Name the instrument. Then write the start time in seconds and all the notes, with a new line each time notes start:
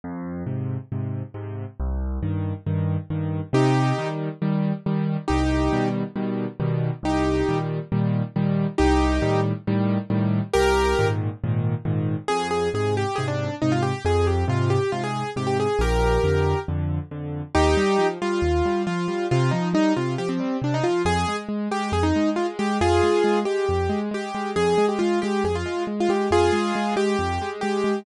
acoustic grand piano
0.04 F2
0.46 G#2 C3
0.92 G#2 C3
1.34 G#2 C3
1.80 C2
2.23 G2 D#3
2.66 G2 D#3
3.10 G2 D#3
3.53 C3 D#4 G4
3.98 D#3 G3
4.42 D#3 G3
4.86 D#3 G3
5.28 C2 D#4 G4
5.73 B2 D#3 G3
6.16 B2 D#3 G3
6.60 B2 D#3 G3
7.03 C2 D#4 G4
7.49 A#2 D#3 G3
7.92 A#2 D#3 G3
8.36 A#2 D#3 G3
8.78 C2 D#4 G4
9.22 A2 D#3 G3
9.67 A2 D#3 G3
10.10 A2 D#3 G3
10.53 C2 G4 A#4
10.99 G#2 A#2 D#3
11.44 G#2 A#2 D#3
11.85 G#2 A#2 D#3
12.28 F2 G#4
12.51 G#4
12.74 G#2 C3 G#4
12.97 G4
13.16 G#2 C3 G#4
13.28 D4
13.62 G#2 C3 D#4
13.72 F4
13.82 G4
14.05 F2 G#4
14.27 G4
14.48 G#2 C3 F4
14.70 G4
14.92 G#2 C3 F4
15.04 G#4
15.36 G#2 C3 G4
15.47 G4
15.60 G#4
15.79 A#1 G4 A#4
16.24 F2 D3
16.68 F2 D3
17.11 F2 D3
17.55 D#2 D#4 G4
17.77 G3
17.98 F3
18.22 G3 F4
18.42 D#2
18.65 G3
18.87 F3 F4
19.08 G3
19.31 C3 F4
19.51 F3 D#4
19.73 G3 D#4
19.96 C3 F4
20.18 F3 G4
20.29 C4
20.40 G3
20.62 C3 D4
20.74 D#4
20.84 F3 F4
21.05 F2 G#4
21.28 G#3
21.49 G#3
21.71 G#3 G4
21.92 F2 G#4
22.03 D#4
22.16 G#3
22.36 G#3 F4
22.59 G#3 G4
22.81 F2 F4 G#4
23.03 G#3
23.24 G#3
23.45 G#3 G4
23.69 F2
23.89 G#3
24.11 G#3 G4
24.35 G#3
24.56 F2 G#4
24.78 G#3
24.89 G4
24.99 G#3 F4
25.22 G#3 G4
25.44 F2 G#4
25.55 F4
25.66 G#3
25.87 G#3
26.00 F4
26.09 G#3 G4
26.31 F2 F4 G#4
26.53 G#3
26.75 G#3
26.96 G#3 G4
27.19 F2
27.42 G#3
27.61 G#3 G4
27.84 G#3